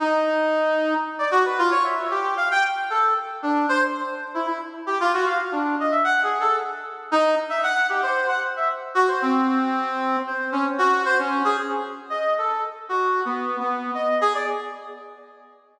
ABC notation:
X:1
M:7/8
L:1/16
Q:1/4=114
K:none
V:1 name="Brass Section"
_E8 z d _G B F _d | e2 G2 f g z2 A2 z2 D2 | c z4 E E z2 G F _G f z | D2 _e =e (3_g2 _A2 =A2 z4 _E2 |
z e _g2 =G c2 _g z e z2 _G c | C8 c2 _D z _G2 | c _D2 _A z4 _e2 =A2 z2 | (3_G4 B,4 B,4 _e2 _A d z2 |]